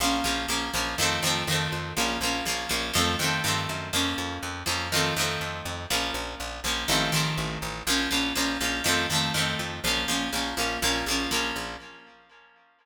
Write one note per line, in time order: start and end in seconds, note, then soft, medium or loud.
0.00 0.21 A#1 loud
0.00 0.23 F3 medium
0.00 0.24 A#3 medium
0.00 0.24 C#4 medium
0.24 0.46 A#1 loud
0.24 0.47 F3 medium
0.24 0.47 A#3 medium
0.24 0.47 C#4 medium
0.48 0.70 A#1 medium
0.48 0.71 F3 medium
0.48 0.71 A#3 medium
0.48 0.71 C#4 medium
0.73 0.95 A#1 loud
0.73 0.96 F3 medium
0.73 0.96 A#3 medium
0.73 0.96 C#4 medium
0.98 1.19 F2 loud
0.98 1.21 D#3 medium
0.98 1.21 F3 medium
0.98 1.21 A3 medium
1.02 1.21 C4 medium
1.22 1.44 F2 medium
1.22 1.45 D#3 medium
1.22 1.45 F3 medium
1.22 1.45 A3 medium
1.27 1.45 C4 medium
1.47 1.68 F2 loud
1.47 1.93 D#3 medium
1.47 1.93 F3 medium
1.47 1.93 A3 medium
1.52 1.93 C4 medium
1.72 1.93 F2 medium
1.97 2.18 A#1 loud
1.97 2.19 F3 medium
1.97 2.19 A#3 medium
1.97 2.19 C#4 medium
2.21 2.42 A#1 medium
2.21 2.44 F3 medium
2.21 2.44 A#3 medium
2.21 2.44 C#4 medium
2.45 2.66 A#1 medium
2.45 2.69 F3 medium
2.45 2.69 A#3 medium
2.45 2.69 C#4 medium
2.69 2.91 A#1 loud
2.69 2.92 F3 medium
2.69 2.92 A#3 medium
2.69 2.92 C#4 medium
2.94 3.16 F2 loud
2.94 3.16 D#3 medium
2.94 3.16 F3 medium
2.94 3.16 A3 medium
2.98 3.16 C4 medium
3.19 3.40 F2 loud
3.19 3.42 D#3 medium
3.19 3.42 F3 medium
3.19 3.42 A3 medium
3.24 3.42 C4 medium
3.44 3.67 G2 loud
3.44 3.89 D#3 medium
3.44 3.89 F3 medium
3.44 3.89 A3 medium
3.48 3.89 C4 medium
3.69 3.91 F#2 loud
3.93 4.14 F2 loud
3.93 4.61 F3 medium
3.93 4.61 A#3 medium
3.93 4.61 C#4 medium
4.18 4.39 F2 loud
4.43 4.64 F2 medium
4.66 5.12 F2 loud
4.66 4.89 F3 medium
4.66 4.89 A#3 medium
4.66 4.89 C#4 medium
4.92 5.15 D#3 medium
4.92 5.15 F3 medium
4.92 5.15 A3 medium
4.96 5.15 C4 medium
5.16 5.37 F2 medium
5.16 5.84 D#3 medium
5.16 5.84 F3 medium
5.16 5.84 A3 medium
5.21 5.84 C4 medium
5.41 5.62 F2 medium
5.65 5.86 F2 medium
5.90 6.11 A#1 loud
5.90 6.58 F3 medium
5.90 6.58 A#3 medium
5.90 6.58 C#4 medium
6.14 6.35 A#1 loud
6.40 6.61 A#1 medium
6.64 6.85 A#1 medium
6.64 6.87 F3 medium
6.64 6.87 A#3 medium
6.64 6.87 C#4 medium
6.88 7.10 A1 loud
6.88 7.11 D#3 medium
6.88 7.11 F3 medium
6.88 7.11 A3 medium
6.92 7.11 C4 medium
7.12 7.34 A1 medium
7.12 7.80 D#3 medium
7.12 7.80 F3 medium
7.12 7.80 A3 medium
7.16 7.80 C4 medium
7.37 7.58 A1 medium
7.62 7.83 A1 medium
7.87 8.08 A#1 loud
7.87 8.10 F3 loud
7.87 8.10 A#3 medium
7.87 8.10 C#4 loud
8.11 8.33 A#1 medium
8.11 8.33 F3 medium
8.11 8.33 A#3 medium
8.11 8.33 C#4 medium
8.35 8.58 A#1 loud
8.35 8.58 F3 medium
8.35 8.58 A#3 medium
8.35 8.58 C#4 medium
8.61 8.81 A#1 loud
8.61 8.83 F3 medium
8.61 8.83 A#3 medium
8.61 8.83 C#4 medium
8.84 9.07 F2 loud
8.84 9.07 D#3 medium
8.84 9.07 F3 medium
8.84 9.07 A3 medium
8.88 9.07 C4 medium
9.10 9.31 F2 medium
9.10 9.33 D#3 medium
9.10 9.33 F3 medium
9.10 9.33 A3 medium
9.15 9.33 C4 medium
9.34 9.55 F2 medium
9.34 9.79 D#3 medium
9.34 9.79 F3 medium
9.34 9.79 A3 medium
9.38 9.79 C4 medium
9.59 9.80 F2 loud
9.84 10.05 A#1 loud
9.84 10.07 F3 medium
9.84 10.07 A#3 medium
9.84 10.07 C#4 medium
10.08 10.29 A#1 medium
10.08 10.31 F3 medium
10.08 10.31 A#3 medium
10.08 10.31 C#4 medium
10.33 10.54 A#1 loud
10.33 10.55 F3 medium
10.33 10.55 A#3 medium
10.33 10.55 C#4 medium
10.57 10.78 A#1 medium
10.57 10.80 F3 medium
10.57 10.80 A#3 medium
10.57 10.80 C#4 medium
10.82 11.03 A#1 loud
10.82 11.05 F3 medium
10.82 11.05 A#3 medium
10.82 11.05 C#4 medium
11.06 11.27 A#1 medium
11.06 11.31 F3 medium
11.06 11.31 A#3 medium
11.11 11.31 C#4 medium
11.31 11.52 A#1 medium
11.31 11.76 F3 medium
11.31 11.76 A#3 medium
11.31 11.76 C#4 medium
11.56 11.77 A#1 medium